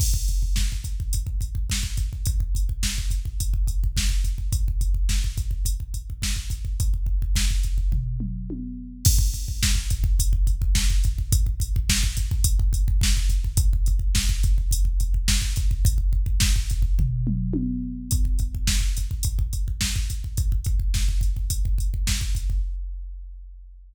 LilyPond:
\new DrumStaff \drummode { \time 4/4 \tempo 4 = 106 <cymc bd>16 bd16 <hh bd>16 bd16 <bd sn>16 bd16 <hh bd>16 bd16 <hh bd>16 bd16 <hh bd>16 bd16 <bd sn>16 bd16 <hh bd>16 bd16 | <hh bd>16 bd16 <hh bd>16 bd16 <bd sn>16 bd16 <hh bd>16 bd16 <hh bd>16 bd16 <hh bd>16 bd16 <bd sn>16 bd16 <hh bd>16 bd16 | <hh bd>16 bd16 <hh bd>16 bd16 <bd sn>16 bd16 <hh bd>16 bd16 <hh bd>16 bd16 <hh bd>16 bd16 <bd sn>16 bd16 <hh bd>16 bd16 | <hh bd>16 bd16 bd16 bd16 <bd sn>16 bd16 <hh bd>16 bd16 <bd tomfh>8 toml8 tommh4 |
<cymc bd>16 bd16 <hh bd>16 bd16 <bd sn>16 bd16 <hh bd>16 bd16 <hh bd>16 bd16 <hh bd>16 bd16 <bd sn>16 bd16 <hh bd>16 bd16 | <hh bd>16 bd16 <hh bd>16 bd16 <bd sn>16 bd16 <hh bd>16 bd16 <hh bd>16 bd16 <hh bd>16 bd16 <bd sn>16 bd16 <hh bd>16 bd16 | <hh bd>16 bd16 <hh bd>16 bd16 <bd sn>16 bd16 <hh bd>16 bd16 <hh bd>16 bd16 <hh bd>16 bd16 <bd sn>16 bd16 <hh bd>16 bd16 | <hh bd>16 bd16 bd16 bd16 <bd sn>16 bd16 <hh bd>16 bd16 <bd tomfh>8 toml8 tommh4 |
<hh bd>16 bd16 <hh bd>16 bd16 <bd sn>16 bd16 <hh bd>16 bd16 <hh bd>16 bd16 <hh bd>16 bd16 <bd sn>16 bd16 <hh bd>16 bd16 | <hh bd>16 bd16 <hh bd>16 bd16 <bd sn>16 bd16 <hh bd>16 bd16 <hh bd>16 bd16 <hh bd>16 bd16 <bd sn>16 bd16 <hh bd>16 bd16 | }